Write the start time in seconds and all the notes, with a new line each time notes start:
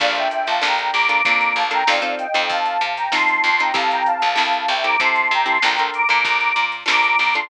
0.00 A#1 A#3 D4 F4 A4 D5 F5, kick, crash
0.15 E5 G5, closed hi-hat
0.31 E5 G5, closed hi-hat
0.47 A#1 F5 A5, closed hi-hat
0.62 A#1 A#3 D4 F4 A4 G5 A#5, snare
0.78 closed hi-hat
0.93 A#1 A#5 D6, closed hi-hat
1.09 A#3 D4 F4 A4 A#5 D6, closed hi-hat
1.24 F2 A#3 D4 F4 A4 A#5 D6, kick, closed hi-hat
1.41 closed hi-hat
1.56 A#1 F5 A5, closed hi-hat
1.71 A#3 D4 F4 A4 G5 A#5, closed hi-hat
1.87 F2 C4 D#4 F4 A4 D5 F5, snare
2.02 C4 D#4 F4 A4, closed hi-hat
2.19 D#5 G5, closed hi-hat
2.34 F2 C4 D#4 F4 A4, closed hi-hat
2.49 F2 F5 A5, kick, closed hi-hat
2.66 closed hi-hat
2.81 C3, closed hi-hat
2.96 G5 A#5, closed hi-hat
3.12 F3 C4 D#4 F4 A4 A5 C6, snare
3.28 closed hi-hat
3.44 F2 A5 C6, closed hi-hat
3.59 C4 D#4 F4 A4 G5 A#5, closed hi-hat
3.74 C2 C4 E4 G4 A4 F5 A5, kick, closed hi-hat
3.91 G5 A#5, closed hi-hat
4.06 F5 A5, closed hi-hat
4.22 C2 F5 A5, closed hi-hat
4.36 C2 C4 E4 G4 A4 F5 A5, snare
4.53 closed hi-hat
4.68 C2 E5 G5, closed hi-hat
4.84 C4 E4 G4 A4 A#5 D6, closed hi-hat
5.00 C3 C4 E4 G4 A4 A5 C6, kick, closed hi-hat
5.15 closed hi-hat
5.31 C3 G5 A#5, closed hi-hat
5.46 C4 E4 G4 A4 A5 C6, closed hi-hat
5.62 A#1 D4 F4 A4 A#4 G5 A#5, snare
5.78 D4 F4 A4 A#4, closed hi-hat
5.94 A#5 D6, closed hi-hat
6.09 A#2 D4 F4 A4 A#4, closed hi-hat
6.24 A#1 A#5 D6, kick, closed hi-hat
6.40 closed hi-hat
6.56 A#2, closed hi-hat
6.72 closed hi-hat
6.86 A#1 D4 F4 A4 A#4 A#5 D6, snare
7.03 closed hi-hat
7.19 A#1 A#5 D6, closed hi-hat
7.34 D4 F4 A4 A#4 A5 C6, closed hi-hat